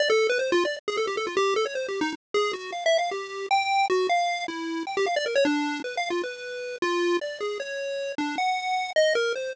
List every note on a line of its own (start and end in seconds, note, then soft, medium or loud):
0.00 0.09 D5 loud
0.10 0.27 A4 loud
0.29 0.38 B4 loud
0.39 0.51 C5 medium
0.52 0.64 F4 loud
0.65 0.77 D5 medium
0.88 0.97 G#4 medium
0.97 1.06 A4 medium
1.07 1.16 G4 medium
1.17 1.26 A4 medium
1.27 1.35 F4 medium
1.37 1.54 G4 loud
1.56 1.65 A4 loud
1.66 1.74 C#5 medium
1.75 1.87 C5 medium
1.88 2.00 G4 medium
2.01 2.13 D#4 loud
2.34 2.52 G#4 loud
2.53 2.71 F#4 medium
2.72 2.84 F5 medium
2.86 2.97 E5 loud
2.98 3.10 F5 medium
3.11 3.46 G4 medium
3.51 3.86 G5 loud
3.90 4.07 F#4 medium
4.09 4.44 F5 medium
4.48 4.83 E4 medium
4.87 4.96 G5 medium
4.97 5.06 G4 loud
5.06 5.15 F5 medium
5.16 5.25 D5 loud
5.26 5.35 A#4 medium
5.35 5.44 C#5 loud
5.45 5.80 D4 loud
5.84 5.96 B4 medium
5.97 6.09 F5 medium
6.10 6.22 F4 medium
6.23 6.76 B4 medium
6.82 7.17 F4 loud
7.21 7.39 D5 medium
7.41 7.58 G#4 medium
7.60 8.12 C#5 medium
8.18 8.36 D4 medium
8.38 8.91 F#5 medium
8.96 9.14 D#5 loud
9.15 9.33 A#4 loud
9.35 9.53 C5 medium